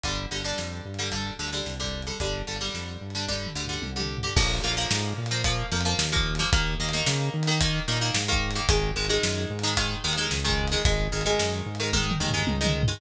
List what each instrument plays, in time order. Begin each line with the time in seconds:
0.03 synth bass 1 G1, acoustic guitar (steel) D3 G3, kick, closed hi-hat
0.31 synth bass 1 G1, acoustic guitar (steel) D3 G3
0.40 closed hi-hat
0.44 acoustic guitar (steel) D3 G3
0.58 synth bass 1 F2, snare
0.85 synth bass 1 G2
0.94 closed hi-hat
0.99 acoustic guitar (steel) D3 G3
1.12 acoustic guitar (steel) D3 G3, kick, closed hi-hat
1.39 synth bass 1 D2, acoustic guitar (steel) D3 G3
1.48 closed hi-hat
1.53 acoustic guitar (steel) D3 G3
1.66 synth bass 1 C2, snare
1.80 acoustic guitar (steel) D3 G3
1.84 kick
2.02 closed hi-hat
2.07 acoustic guitar (steel) D3 G3
2.20 synth bass 1 G1, acoustic guitar (steel) D3 G3, kick, closed hi-hat
2.47 synth bass 1 G1, acoustic guitar (steel) D3 G3
2.56 closed hi-hat
2.61 acoustic guitar (steel) D3 G3
2.74 synth bass 1 F2, snare
3.01 synth bass 1 G2
3.10 closed hi-hat
3.15 acoustic guitar (steel) D3 G3
3.28 acoustic guitar (steel) D3 G3, kick, high tom
3.46 mid tom
3.55 synth bass 1 D2, acoustic guitar (steel) D3 G3
3.65 floor tom
3.69 acoustic guitar (steel) D3 G3
3.82 synth bass 1 C2, high tom
3.96 acoustic guitar (steel) D3 G3
4.00 mid tom
4.18 floor tom
4.23 acoustic guitar (steel) D3 G3
4.36 synth bass 1 A#1, acoustic guitar (steel) F3 A#3, kick, crash
4.63 synth bass 1 A#1, acoustic guitar (steel) F3 A#3
4.72 closed hi-hat
4.77 acoustic guitar (steel) F3 A#3
4.91 synth bass 1 G#2, snare
5.18 synth bass 1 A#2
5.26 closed hi-hat
5.31 acoustic guitar (steel) F3 A#3
5.44 acoustic guitar (steel) F3 A#3, kick, closed hi-hat
5.72 synth bass 1 F2, acoustic guitar (steel) F3 A#3
5.81 closed hi-hat
5.85 acoustic guitar (steel) F3 A#3
5.98 synth bass 1 D#2, snare
6.12 acoustic guitar (steel) F3 A#3
6.16 kick
6.35 closed hi-hat
6.39 acoustic guitar (steel) F3 A#3
6.52 synth bass 1 D#2, acoustic guitar (steel) D#3 A#3, kick, closed hi-hat
6.80 synth bass 1 D#2, acoustic guitar (steel) D#3 A#3
6.89 closed hi-hat
6.93 acoustic guitar (steel) D#3 A#3
7.06 synth bass 1 C#3, snare
7.34 synth bass 1 D#3
7.43 closed hi-hat
7.47 acoustic guitar (steel) D#3 A#3
7.61 acoustic guitar (steel) D#3 A#3, kick, closed hi-hat
7.88 synth bass 1 A#2, acoustic guitar (steel) D#3 A#3
7.97 closed hi-hat
8.01 acoustic guitar (steel) D#3 A#3
8.14 synth bass 1 G#2, snare
8.28 acoustic guitar (steel) D#3 A#3
8.33 kick
8.51 closed hi-hat
8.55 acoustic guitar (steel) D#3 A#3
8.69 synth bass 1 G#1, acoustic guitar (steel) D#3 G#3, kick, closed hi-hat
8.96 synth bass 1 G#1, acoustic guitar (steel) D#3 G#3
9.05 closed hi-hat
9.09 acoustic guitar (steel) D#3 G#3
9.23 synth bass 1 F#2, snare
9.50 synth bass 1 G#2
9.59 closed hi-hat
9.63 acoustic guitar (steel) D#3 G#3
9.77 acoustic guitar (steel) D#3 G#3, kick, closed hi-hat
10.04 synth bass 1 D#2, acoustic guitar (steel) D#3 G#3
10.13 closed hi-hat
10.17 acoustic guitar (steel) D#3 G#3
10.31 synth bass 1 C#2, snare
10.44 acoustic guitar (steel) D#3 G#3
10.49 kick
10.67 closed hi-hat
10.72 acoustic guitar (steel) D#3 G#3
10.85 synth bass 1 G#1, acoustic guitar (steel) D#3 G#3, kick, closed hi-hat
11.12 synth bass 1 G#1, acoustic guitar (steel) D#3 G#3
11.21 closed hi-hat
11.26 acoustic guitar (steel) D#3 G#3
11.39 synth bass 1 F#2, snare
11.66 synth bass 1 G#2
11.75 closed hi-hat
11.80 acoustic guitar (steel) D#3 G#3
11.93 acoustic guitar (steel) D#3 G#3, kick, high tom
12.11 mid tom
12.20 synth bass 1 D#2, acoustic guitar (steel) D#3 G#3
12.29 floor tom
12.34 acoustic guitar (steel) D#3 G#3
12.47 synth bass 1 C#2, high tom
12.61 acoustic guitar (steel) D#3 G#3
12.65 mid tom
12.83 floor tom
12.88 acoustic guitar (steel) D#3 G#3